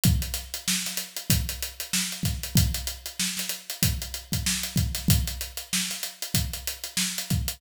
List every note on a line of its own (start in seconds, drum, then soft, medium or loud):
0.04 kick loud
0.04 closed hi-hat loud
0.22 closed hi-hat medium
0.34 snare soft
0.34 closed hi-hat medium
0.54 closed hi-hat medium
0.68 snare loud
0.86 snare medium
0.86 closed hi-hat medium
0.97 snare soft
0.97 closed hi-hat medium
1.17 closed hi-hat medium
1.30 kick loud
1.30 closed hi-hat loud
1.49 closed hi-hat medium
1.63 closed hi-hat medium
1.80 closed hi-hat medium
1.93 snare loud
2.12 closed hi-hat medium
2.23 kick medium
2.23 snare soft
2.23 closed hi-hat medium
2.43 closed hi-hat medium
2.56 kick loud
2.56 closed hi-hat loud
2.74 closed hi-hat medium
2.87 closed hi-hat medium
3.06 closed hi-hat medium
3.20 snare loud
3.37 snare medium
3.37 closed hi-hat medium
3.49 closed hi-hat medium
3.70 closed hi-hat medium
3.83 kick loud
3.83 closed hi-hat loud
4.02 closed hi-hat medium
4.14 closed hi-hat medium
4.32 kick medium
4.32 closed hi-hat medium
4.46 snare loud
4.63 closed hi-hat medium
4.76 kick loud
4.76 closed hi-hat medium
4.95 snare soft
4.95 closed hi-hat medium
5.08 kick loud
5.08 closed hi-hat loud
5.28 closed hi-hat medium
5.41 closed hi-hat medium
5.57 closed hi-hat medium
5.73 snare loud
5.90 snare medium
5.90 closed hi-hat medium
6.03 closed hi-hat medium
6.22 closed hi-hat medium
6.34 kick medium
6.34 closed hi-hat loud
6.53 closed hi-hat medium
6.67 closed hi-hat medium
6.84 closed hi-hat medium
6.97 snare loud
7.18 closed hi-hat medium
7.30 kick loud
7.30 closed hi-hat medium
7.48 closed hi-hat loud